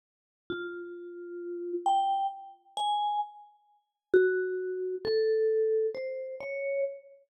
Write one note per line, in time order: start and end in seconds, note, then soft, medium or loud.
0.50 1.73 F4 medium
1.86 2.27 G5 medium
2.77 3.18 G#5 medium
4.14 4.95 F#4 medium
5.05 5.87 A4 medium
5.95 6.35 C5 medium
6.40 6.81 C#5 medium